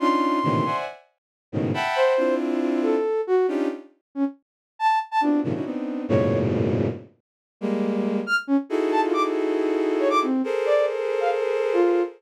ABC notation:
X:1
M:4/4
L:1/16
Q:1/4=138
K:none
V:1 name="Violin"
[_D=D_EF]4 [A,,_B,,C,D,_E,=E,]2 [cde_g_a]2 z6 [_A,,=A,,=B,,_D,_E,]2 | [e_g=gab]4 [CDEF]8 z4 | [_D=D_EFG]2 z14 | [B,CDEF_G]2 [_A,,_B,,C,_D,_E,F,] [_D=D_E=EG] [=B,CD_E]4 [_G,,A,,=A,,_B,,=B,,_D,]8 |
z6 [G,_A,_B,]6 z4 | [_E=E_G_A=A]16 | [_A=A_Bc]16 |]
V:2 name="Flute"
c'8 z8 | z2 c4 z4 A4 _G2 | z6 _D z5 a2 z a | D2 z6 _d3 z5 |
z12 f' z _D z | z2 a F d' z7 _d =d' C2 | z2 d2 z3 f z4 F3 z |]